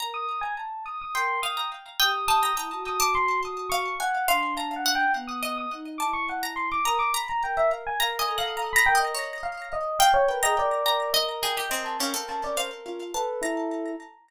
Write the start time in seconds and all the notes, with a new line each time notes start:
0.00 A#4 A#5
0.14 D#6
0.41 G#5
0.58 A5
0.86 D#6
1.02 D#6
1.14 A#4 G5 C6
1.43 F5 D#6
1.57 A#5
2.00 G4 G5 D#6
2.28 A5 D#6
2.43 A#5
2.55 E4 A#5 D#6
2.72 F#4
2.87 D#6
3.00 A5 D6
3.15 C6
3.45 D#6
3.70 F5 C#6
4.00 F#5 G#5
4.28 D4 F5 C6
4.57 A5 A#5
4.76 F#5
4.86 F#5
4.95 G5
5.15 B3
5.28 D#6
5.43 D#5 D#6
5.58 D#6
5.72 D#4
5.98 E4 A5 D6
6.13 C#6
6.29 F#5
6.43 A#5
6.56 C6
6.72 D6
6.85 A#4 A#5 D#6
6.99 D6
7.14 A#5 B5
7.29 A#5
7.43 A#4 G5
7.57 E5
7.71 F5
7.87 G#5
8.00 A#4 F5 A#5
8.19 D#5 G#5
8.28 A4
8.38 F5 F#5
8.57 A#5
8.73 A#5 B5
8.86 A#4 G5
8.95 D#5
8.99 D#5
9.15 C#5
9.43 F5
9.73 D#5
9.99 F5 G5
10.14 C#5
10.28 A#4 B4
10.42 G#4 D#5 A#5
10.56 A#4 D5
10.86 A#4 A#5
11.13 D#5
11.43 G#4 G5
11.57 G4
11.70 C4 A#4 D#5
11.85 A5
12.00 C#4 A#4 F5
12.14 A4
12.29 A5
12.44 D5
12.57 C5 F5
12.86 F4
13.14 A4 B4 A5
13.42 E4 A#5